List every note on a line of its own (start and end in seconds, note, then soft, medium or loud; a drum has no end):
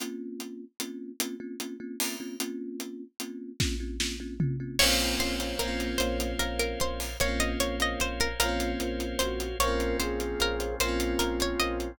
0.00 0.64 A#3 medium
0.00 0.64 C4 medium
0.00 0.64 C#4 medium
0.00 0.64 F4 medium
0.00 closed hi-hat medium
0.40 closed hi-hat soft
0.80 1.12 A#3 medium
0.80 1.12 C4 medium
0.80 1.12 C#4 medium
0.80 1.12 F4 medium
0.80 closed hi-hat medium
1.20 1.36 A#3 medium
1.20 1.36 C4 medium
1.20 1.36 C#4 medium
1.20 1.36 F4 medium
1.20 closed hi-hat medium
1.40 1.56 A#3 medium
1.40 1.56 C4 medium
1.40 1.56 C#4 medium
1.40 1.56 F4 medium
1.60 1.76 A#3 medium
1.60 1.76 C4 medium
1.60 1.76 C#4 medium
1.60 1.76 F4 medium
1.60 closed hi-hat medium
1.80 1.96 A#3 medium
1.80 1.96 C4 medium
1.80 1.96 C#4 medium
1.80 1.96 F4 medium
2.00 2.16 A#3 medium
2.00 2.16 C4 medium
2.00 2.16 C#4 medium
2.00 2.16 F4 medium
2.00 open hi-hat medium
2.20 2.36 A#3 medium
2.20 2.36 C4 medium
2.20 2.36 C#4 medium
2.20 2.36 F4 medium
2.40 3.04 A#3 medium
2.40 3.04 C4 medium
2.40 3.04 C#4 loud
2.40 3.04 F4 medium
2.40 closed hi-hat medium
2.80 closed hi-hat medium
3.20 3.52 A#3 medium
3.20 3.52 C4 medium
3.20 3.52 C#4 medium
3.20 3.52 F4 medium
3.20 closed hi-hat medium
3.60 3.76 A#3 medium
3.60 3.76 C4 medium
3.60 3.76 C#4 loud
3.60 3.76 F4 medium
3.60 kick medium
3.60 snare medium
3.80 3.96 A#3 medium
3.80 3.96 C4 medium
3.80 3.96 C#4 medium
3.80 3.96 F4 medium
4.00 4.16 A#3 medium
4.00 4.16 C4 medium
4.00 4.16 C#4 medium
4.00 4.16 F4 medium
4.00 snare medium
4.20 4.36 A#3 medium
4.20 4.36 C4 medium
4.20 4.36 C#4 medium
4.20 4.36 F4 medium
4.40 4.56 A#3 medium
4.40 4.56 C4 medium
4.40 4.56 C#4 medium
4.40 4.56 F4 medium
4.40 floor tom medium
4.60 4.76 A#3 medium
4.60 4.76 C4 medium
4.60 4.76 C#4 medium
4.60 4.76 F4 medium
4.79 5.15 A#1 loud
4.79 5.56 A#3 medium
4.79 5.44 C4 medium
4.79 5.56 C4 medium
4.79 5.12 A#4 medium
4.79 5.98 A#4 medium
4.79 5.12 C5 medium
4.79 5.98 C5 medium
4.79 5.12 C#5 medium
4.79 5.98 C#5 medium
4.79 5.12 F5 medium
4.79 5.98 F5 medium
4.79 crash medium
4.85 5.56 C#4 medium
4.85 5.56 F4 medium
5.00 closed hi-hat soft
5.19 5.53 A#1 medium
5.19 5.36 A#4 medium
5.19 5.55 C5 medium
5.19 5.36 C5 medium
5.19 5.36 C#5 medium
5.19 5.36 F5 medium
5.19 closed hi-hat medium
5.40 5.88 A#4 medium
5.40 5.88 C5 medium
5.40 5.88 C#5 medium
5.40 5.88 F5 medium
5.40 closed hi-hat medium
5.59 5.94 A#1 medium
5.59 7.08 A#3 medium
5.59 6.26 A#3 medium
5.59 7.08 C4 medium
5.59 5.93 A#4 medium
5.59 closed hi-hat medium
5.65 7.08 C#4 medium
5.65 7.08 F4 medium
5.80 closed hi-hat soft
5.98 6.33 A#1 loud
5.98 7.17 A#4 medium
5.98 6.32 A#4 medium
5.98 6.17 C5 medium
5.98 7.17 C5 medium
5.98 6.32 C5 medium
5.98 7.17 C#5 medium
5.98 6.32 C#5 medium
5.98 7.17 F5 medium
5.98 6.32 F5 medium
5.98 closed hi-hat medium
6.20 closed hi-hat medium
6.39 6.74 A#1 medium
6.39 6.58 A#4 medium
6.39 7.04 A#4 medium
6.39 7.04 C5 medium
6.39 7.04 C#5 medium
6.39 7.04 F5 medium
6.39 closed hi-hat medium
6.59 6.78 A#4 medium
6.59 closed hi-hat soft
6.80 7.15 A#1 medium
6.80 7.00 C5 medium
6.80 closed hi-hat medium
7.00 open hi-hat soft
7.20 7.55 A#1 loud
7.20 8.28 A#3 medium
7.20 8.28 C4 medium
7.20 7.52 A#4 medium
7.20 8.39 A#4 medium
7.20 7.52 C5 medium
7.20 8.39 C5 medium
7.20 7.52 C#5 medium
7.20 8.39 C#5 medium
7.20 7.40 C#5 medium
7.20 7.52 F5 medium
7.20 8.39 F5 medium
7.20 closed hi-hat medium
7.25 8.28 C#4 medium
7.25 8.28 F4 medium
7.40 7.59 D#5 medium
7.40 closed hi-hat medium
7.60 7.95 A#1 medium
7.60 7.76 A#4 medium
7.60 7.76 C5 medium
7.60 7.76 C#5 medium
7.60 7.79 C#5 medium
7.60 7.76 F5 medium
7.60 closed hi-hat medium
7.80 8.28 A#4 medium
7.80 8.28 C5 medium
7.80 8.28 C#5 medium
7.80 8.01 D#5 medium
7.80 8.28 F5 medium
7.80 closed hi-hat medium
8.00 8.34 A#1 medium
8.00 8.20 C5 medium
8.00 closed hi-hat medium
8.20 8.39 A#4 medium
8.20 closed hi-hat soft
8.39 8.74 A#1 medium
8.39 9.49 A#3 medium
8.39 9.49 C4 medium
8.39 9.05 F4 medium
8.39 9.58 A#4 medium
8.39 9.08 A#4 medium
8.39 8.72 A#4 medium
8.39 9.58 C5 medium
8.39 8.72 C5 medium
8.39 9.58 C#5 medium
8.39 8.72 C#5 medium
8.39 9.58 F5 medium
8.39 8.72 F5 medium
8.39 closed hi-hat medium
8.46 9.49 C#4 medium
8.46 9.49 F4 medium
8.60 closed hi-hat medium
8.80 9.14 A#1 medium
8.80 9.44 A#4 medium
8.80 9.44 C5 medium
8.80 9.44 C#5 medium
8.80 9.44 F5 medium
8.80 closed hi-hat medium
9.00 closed hi-hat soft
9.19 9.54 A#1 medium
9.19 9.56 F#4 medium
9.19 9.58 C5 medium
9.19 closed hi-hat medium
9.40 closed hi-hat medium
9.59 9.93 A#1 loud
9.59 10.68 A#3 medium
9.59 10.79 A#3 medium
9.59 10.79 C4 medium
9.59 10.68 C4 medium
9.59 10.79 C#4 medium
9.59 10.79 F4 medium
9.59 9.97 A#4 medium
9.59 10.24 A#4 medium
9.59 10.24 C5 medium
9.59 9.93 C#5 medium
9.59 10.24 C#5 medium
9.59 10.24 F5 medium
9.59 closed hi-hat medium
9.65 10.68 C#4 medium
9.65 10.68 F4 medium
9.80 closed hi-hat soft
10.00 10.34 A#1 medium
10.00 10.75 G#4 medium
10.00 10.32 C5 medium
10.00 closed hi-hat medium
10.20 closed hi-hat soft
10.40 10.74 A#1 medium
10.40 10.56 A#4 medium
10.40 10.76 A#4 medium
10.40 10.56 C5 medium
10.40 10.56 C#5 medium
10.40 10.56 F5 medium
10.40 closed hi-hat medium
10.60 10.76 A#4 medium
10.60 10.76 C5 medium
10.60 10.76 C#5 medium
10.60 10.76 F5 medium
10.60 closed hi-hat medium
10.79 11.14 A#1 loud
10.79 11.98 A#3 medium
10.79 11.88 A#3 medium
10.79 11.98 C4 medium
10.79 11.88 C4 medium
10.79 11.98 C#4 medium
10.79 11.98 F4 medium
10.79 11.92 F4 medium
10.79 11.44 A#4 medium
10.79 11.44 C5 medium
10.79 11.00 C5 medium
10.79 11.44 C#5 medium
10.79 11.44 F5 medium
10.79 closed hi-hat medium
10.85 11.88 C#4 medium
10.85 11.88 F4 medium
11.00 closed hi-hat medium
11.19 11.54 A#1 medium
11.19 11.38 A#4 medium
11.19 closed hi-hat medium
11.40 11.61 C#5 medium
11.40 closed hi-hat medium
11.59 11.93 A#1 medium
11.59 11.92 A#4 medium
11.59 11.92 C5 medium
11.59 11.92 C#5 medium
11.59 11.79 D#5 medium
11.59 11.92 F5 medium
11.59 closed hi-hat medium
11.80 closed hi-hat soft